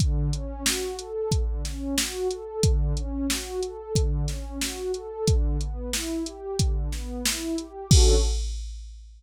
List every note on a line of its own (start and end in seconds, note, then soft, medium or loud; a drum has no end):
0.00 0.30 D3 loud
0.00 kick medium
0.00 closed hi-hat medium
0.33 0.63 C#4 loud
0.33 closed hi-hat medium
0.66 0.96 F#4 medium
0.66 snare loud
0.99 1.29 A4 medium
0.99 closed hi-hat medium
1.31 1.62 D3 medium
1.31 kick medium
1.31 closed hi-hat medium
1.65 1.95 C#4 medium
1.65 snare soft
1.65 closed hi-hat medium
1.98 2.28 F#4 medium
1.98 snare medium
2.30 2.61 A4 medium
2.30 closed hi-hat medium
2.63 2.93 D3 loud
2.63 kick medium
2.63 closed hi-hat medium
2.97 3.27 C#4 medium
2.97 closed hi-hat medium
3.30 3.60 F#4 medium
3.30 snare medium
3.63 3.93 A4 medium
3.63 closed hi-hat medium
3.95 4.26 D3 medium
3.95 kick medium
3.95 closed hi-hat medium
4.28 4.58 C#4 medium
4.28 snare soft
4.28 closed hi-hat medium
4.61 4.92 F#4 medium
4.61 snare medium
4.94 5.24 A4 medium
4.94 closed hi-hat medium
5.27 5.57 D3 loud
5.27 kick medium
5.27 closed hi-hat medium
5.60 5.90 B3 medium
5.60 closed hi-hat medium
5.93 6.23 E4 medium
5.93 snare medium
6.26 6.57 G4 medium
6.26 closed hi-hat medium
6.59 6.89 D3 medium
6.59 kick medium
6.59 closed hi-hat medium
6.92 7.23 B3 medium
6.92 snare soft
7.25 7.56 E4 medium
7.25 snare loud
7.58 7.89 G4 medium
7.58 closed hi-hat medium
7.91 8.15 D3 loud
7.91 8.15 C#4 medium
7.91 8.15 F#4 loud
7.91 8.15 A4 loud
7.91 kick loud
7.91 crash loud